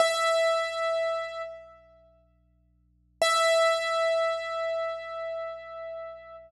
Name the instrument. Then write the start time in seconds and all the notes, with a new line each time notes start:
acoustic grand piano
0.00 E5
3.22 E5